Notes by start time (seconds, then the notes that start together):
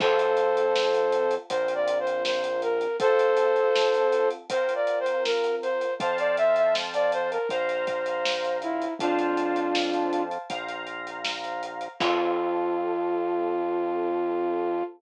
0.00 F2 C4 F4 A4 C5, kick, crash
0.19 closed hi-hat
0.37 closed hi-hat
0.57 closed hi-hat
0.76 snare
0.94 closed hi-hat
1.12 closed hi-hat
1.31 closed hi-hat
1.50 A#1 C4 F4 A#4 C5, kick, closed hi-hat
1.68 closed hi-hat
1.75 D5
1.88 closed hi-hat
2.00 C5
2.07 closed hi-hat
2.25 C5, snare
2.44 closed hi-hat
2.62 A#4, closed hi-hat
2.81 closed hi-hat
3.00 C4 F4 A4 C5, kick, closed hi-hat
3.19 closed hi-hat
3.37 closed hi-hat
3.56 closed hi-hat
3.75 snare
3.94 closed hi-hat
4.12 closed hi-hat
4.30 closed hi-hat
4.50 C4 F4 A#4 C5, kick, closed hi-hat
4.69 closed hi-hat
4.75 D5
4.87 closed hi-hat
5.00 C5
5.06 closed hi-hat
5.25 A#4, snare
5.44 closed hi-hat
5.62 C5, closed hi-hat
5.81 closed hi-hat
6.00 F2 C5 F5 A5, kick, closed hi-hat
6.18 D5, closed hi-hat
6.37 E5, closed hi-hat
6.56 E5, closed hi-hat
6.75 snare
6.94 D5, closed hi-hat
7.12 C5, closed hi-hat
7.31 A#4, closed hi-hat
7.49 A#1 C5 F5 A#5, kick, closed hi-hat
7.69 closed hi-hat
7.87 kick, closed hi-hat
8.06 closed hi-hat
8.25 snare
8.44 closed hi-hat
8.62 E4, closed hi-hat
8.82 closed hi-hat
8.99 F2 D4 F4 C5 F5 A5, kick, closed hi-hat
9.19 closed hi-hat
9.37 closed hi-hat
9.56 closed hi-hat
9.75 snare
9.94 closed hi-hat
10.13 closed hi-hat
10.31 closed hi-hat
10.50 A#1 C5 F5 A#5, kick, closed hi-hat
10.69 closed hi-hat
10.87 closed hi-hat
11.07 closed hi-hat
11.25 snare
11.44 closed hi-hat
11.63 closed hi-hat
11.81 closed hi-hat
12.00 F2 C4 F4 A4, kick, crash